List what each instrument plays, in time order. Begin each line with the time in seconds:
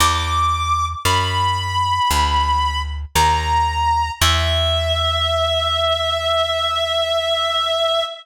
0.00 electric bass (finger) E2, clarinet D6
1.05 electric bass (finger) F#2, clarinet B5
2.11 electric bass (finger) D2
3.15 electric bass (finger) D#2, clarinet A#5
4.21 electric bass (finger) E2, clarinet E5